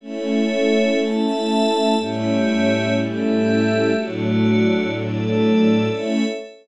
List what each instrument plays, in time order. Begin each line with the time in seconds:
0.01 string ensemble 1 A3 C#4 E4, pad 5 (bowed) A4 C#5 E5
0.98 pad 5 (bowed) A4 E5 A5
1.96 string ensemble 1 A2 G3 C#4 E4, pad 5 (bowed) A3 G4 C#5 E5
2.96 pad 5 (bowed) A3 G4 A4 E5
3.93 string ensemble 1 A2 F#3 D4, pad 5 (bowed) A3 F#4 D5
4.92 pad 5 (bowed) A3 A4 D5
5.89 string ensemble 1 A3 C#4 E4, pad 5 (bowed) A4 C#5 E5